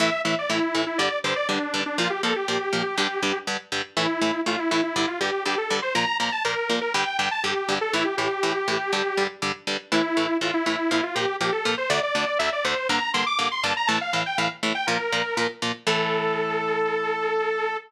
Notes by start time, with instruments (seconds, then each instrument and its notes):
0.00 overdriven guitar A2 E3 A3, lead 2 (sawtooth) E5
0.25 overdriven guitar A2 E3 A3, lead 2 (sawtooth) E5
0.39 lead 2 (sawtooth) D5
0.50 overdriven guitar A2 E3 A3, lead 2 (sawtooth) E4
0.75 overdriven guitar A2 E3 A3
0.87 lead 2 (sawtooth) E4
0.98 overdriven guitar G2 D3 G3, lead 2 (sawtooth) D5
1.24 overdriven guitar G2 D3 G3, lead 2 (sawtooth) C5
1.36 lead 2 (sawtooth) D5
1.49 overdriven guitar G2 D3 G3, lead 2 (sawtooth) D4
1.74 overdriven guitar G2 D3 G3
1.86 lead 2 (sawtooth) D4
1.98 overdriven guitar A#2 F3 A#3, lead 2 (sawtooth) F4
2.10 lead 2 (sawtooth) G4
2.23 overdriven guitar A#2 F3 A#3, lead 2 (sawtooth) A4
2.36 lead 2 (sawtooth) G4
2.48 overdriven guitar A#2 F3 A#3
2.73 overdriven guitar A#2 F3 A#3
2.98 overdriven guitar G2 D3 G3
3.23 overdriven guitar G2 D3 G3
3.47 overdriven guitar G2 D3 G3
3.72 overdriven guitar G2 D3 G3
3.97 overdriven guitar A2 E3 A3, lead 2 (sawtooth) E4
4.21 overdriven guitar A2 E3 A3
4.46 overdriven guitar A2 E3 A3, lead 2 (sawtooth) F4
4.59 lead 2 (sawtooth) E4
4.71 overdriven guitar A2 E3 A3, lead 2 (sawtooth) E4
4.83 lead 2 (sawtooth) E4
4.96 overdriven guitar G2 D3 G3, lead 2 (sawtooth) E4
5.08 lead 2 (sawtooth) F4
5.20 overdriven guitar G2 D3 G3, lead 2 (sawtooth) G4
5.45 overdriven guitar G2 D3 G3, lead 2 (sawtooth) G4
5.58 lead 2 (sawtooth) A4
5.70 overdriven guitar G2 D3 G3
5.82 lead 2 (sawtooth) C5
5.95 overdriven guitar A#2 F3 A#3, lead 2 (sawtooth) A#5
6.20 overdriven guitar A#2 F3 A#3, lead 2 (sawtooth) A#5
6.32 lead 2 (sawtooth) A5
6.45 overdriven guitar A#2 F3 A#3, lead 2 (sawtooth) A#4
6.70 overdriven guitar A#2 F3 A#3
6.81 lead 2 (sawtooth) A#4
6.94 overdriven guitar G2 D3 G3, lead 2 (sawtooth) G5
7.18 overdriven guitar G2 D3 G3, lead 2 (sawtooth) G5
7.31 lead 2 (sawtooth) A5
7.44 overdriven guitar G2 D3 G3, lead 2 (sawtooth) G4
7.69 overdriven guitar G2 D3 G3
7.81 lead 2 (sawtooth) A4
7.93 overdriven guitar A2 E3 A3, lead 2 (sawtooth) E4
8.05 lead 2 (sawtooth) G4
8.17 overdriven guitar A2 E3 A3, lead 2 (sawtooth) G4
8.43 overdriven guitar A2 E3 A3
8.68 overdriven guitar A2 E3 A3
8.93 overdriven guitar G2 D3 G3
9.17 overdriven guitar G2 D3 G3
9.42 overdriven guitar G2 D3 G3
9.67 overdriven guitar G2 D3 G3
9.92 overdriven guitar A2 E3 A3, lead 2 (sawtooth) E4
10.17 overdriven guitar A2 E3 A3
10.41 overdriven guitar A2 E3 A3, lead 2 (sawtooth) F4
10.54 lead 2 (sawtooth) E4
10.66 overdriven guitar A2 E3 A3, lead 2 (sawtooth) E4
10.78 lead 2 (sawtooth) E4
10.91 overdriven guitar A#2 F3 A#3, lead 2 (sawtooth) E4
11.03 lead 2 (sawtooth) F4
11.15 overdriven guitar A#2 F3 A#3, lead 2 (sawtooth) G4
11.41 overdriven guitar A#2 F3 A#3, lead 2 (sawtooth) G4
11.52 lead 2 (sawtooth) A4
11.65 overdriven guitar A#2 F3 A#3
11.78 lead 2 (sawtooth) C5
11.90 overdriven guitar D2 D3 A3, lead 2 (sawtooth) D5
12.03 lead 2 (sawtooth) D5
12.15 overdriven guitar D2 D3 A3
12.39 overdriven guitar D2 D3 A3, lead 2 (sawtooth) E5
12.52 lead 2 (sawtooth) D5
12.65 overdriven guitar D2 D3 A3, lead 2 (sawtooth) C5
12.89 overdriven guitar G2 D3 A#3, lead 2 (sawtooth) A#5
13.14 overdriven guitar G2 D3 A#3, lead 2 (sawtooth) C6
13.26 lead 2 (sawtooth) D6
13.39 overdriven guitar G2 D3 A#3
13.51 lead 2 (sawtooth) C6
13.63 overdriven guitar G2 D3 A#3, lead 2 (sawtooth) A5
13.77 lead 2 (sawtooth) A#5
13.87 overdriven guitar A2 E3 A3, lead 2 (sawtooth) A5
14.01 lead 2 (sawtooth) F5
14.13 overdriven guitar A2 E3 A3
14.26 lead 2 (sawtooth) G5
14.38 overdriven guitar A2 E3 A3, lead 2 (sawtooth) F5
14.63 overdriven guitar A2 E3 A3
14.75 lead 2 (sawtooth) G5
14.87 overdriven guitar A#2 F3 A#3, lead 2 (sawtooth) A#4
15.13 overdriven guitar A#2 F3 A#3
15.37 overdriven guitar A#2 F3 A#3
15.62 overdriven guitar A#2 F3 A#3
15.87 overdriven guitar A2 E3 A3, lead 2 (sawtooth) A4